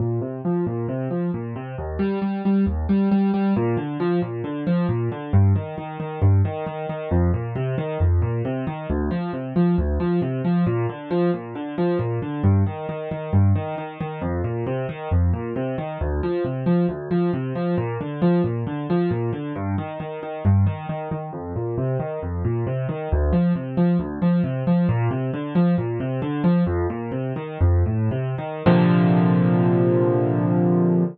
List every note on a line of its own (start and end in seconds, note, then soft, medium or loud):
0.00 0.20 A#2 medium
0.21 0.41 C3 medium
0.45 0.65 F3 medium
0.67 0.87 A#2 medium
0.89 1.09 C3 medium
1.11 1.31 F3 medium
1.34 1.54 A#2 medium
1.56 1.76 C3 medium
1.78 1.98 D#2 medium
1.99 2.19 G3 medium
2.22 2.42 G3 medium
2.45 2.65 G3 medium
2.66 2.86 D#2 medium
2.89 3.09 G3 medium
3.11 3.31 G3 medium
3.34 3.54 G3 medium
3.56 3.76 A#2 medium
3.77 3.97 D3 medium
4.00 4.20 F3 medium
4.22 4.42 A#2 medium
4.44 4.64 D3 medium
4.67 4.87 F3 medium
4.89 5.09 A#2 medium
5.12 5.32 D3 medium
5.33 5.53 G2 medium
5.55 5.75 D#3 medium
5.78 5.98 D#3 medium
6.00 6.20 D#3 medium
6.22 6.42 G2 medium
6.45 6.65 D#3 medium
6.66 6.86 D#3 medium
6.89 7.09 D#3 medium
7.11 7.31 F2 medium
7.34 7.54 A#2 medium
7.55 7.75 C3 medium
7.78 7.98 D#3 medium
8.00 8.20 F2 medium
8.22 8.42 A#2 medium
8.45 8.65 C3 medium
8.67 8.87 D#3 medium
8.90 9.10 D2 medium
9.11 9.31 F3 medium
9.33 9.53 C3 medium
9.56 9.76 F3 medium
9.78 9.98 D2 medium
10.00 10.20 F3 medium
10.22 10.42 C3 medium
10.45 10.65 F3 medium
10.66 10.86 A#2 medium
10.89 11.09 D3 medium
11.11 11.31 F3 medium
11.34 11.54 A#2 medium
11.55 11.75 D3 medium
11.78 11.98 F3 medium
11.99 12.19 A#2 medium
12.22 12.42 D3 medium
12.44 12.64 G2 medium
12.66 12.86 D#3 medium
12.89 13.09 D#3 medium
13.11 13.31 D#3 medium
13.33 13.53 G2 medium
13.55 13.75 D#3 medium
13.78 13.98 D#3 medium
14.00 14.20 D#3 medium
14.21 14.41 F2 medium
14.44 14.64 A#2 medium
14.67 14.87 C3 medium
14.89 15.09 D#3 medium
15.11 15.31 F2 medium
15.33 15.53 A#2 medium
15.56 15.76 C3 medium
15.78 15.98 D#3 medium
16.01 16.21 D2 medium
16.23 16.43 F3 medium
16.44 16.64 C3 medium
16.66 16.86 F3 medium
16.89 17.09 D2 medium
17.11 17.31 F3 medium
17.33 17.53 C3 medium
17.55 17.75 F3 medium
17.78 17.98 A#2 medium
18.01 18.21 D3 medium
18.22 18.42 F3 medium
18.44 18.64 A#2 medium
18.67 18.87 D3 medium
18.90 19.10 F3 medium
19.11 19.31 A#2 medium
19.33 19.53 D3 medium
19.56 19.76 G2 medium
19.78 19.98 D#3 medium
20.00 20.20 D#3 medium
20.23 20.43 D#3 medium
20.45 20.65 G2 medium
20.66 20.86 D#3 medium
20.89 21.09 D#3 medium
21.11 21.31 D#3 medium
21.33 21.53 F2 medium
21.56 21.76 A#2 medium
21.78 21.98 C3 medium
22.00 22.20 D#3 medium
22.22 22.42 F2 medium
22.45 22.65 A#2 medium
22.67 22.87 C3 medium
22.89 23.09 D#3 medium
23.12 23.32 D2 medium
23.33 23.53 F3 medium
23.55 23.75 C3 medium
23.77 23.97 F3 medium
23.99 24.19 D2 medium
24.22 24.42 F3 medium
24.44 24.64 C3 medium
24.67 24.87 F3 medium
24.89 25.09 A#2 medium
25.11 25.31 C3 medium
25.34 25.54 D3 medium
25.55 25.75 F3 medium
25.78 25.98 A#2 medium
26.00 26.20 C3 medium
26.22 26.42 D3 medium
26.44 26.64 F3 medium
26.66 26.87 F2 medium
26.90 27.11 A#2 medium
27.12 27.33 C3 medium
27.36 27.58 D#3 medium
27.61 27.83 F2 medium
27.86 28.09 A2 medium
28.11 28.35 C3 medium
28.38 28.63 D#3 medium
28.66 31.04 A#2 loud
28.66 31.04 C3 medium
28.66 31.04 D3 loud
28.66 31.04 F3 loud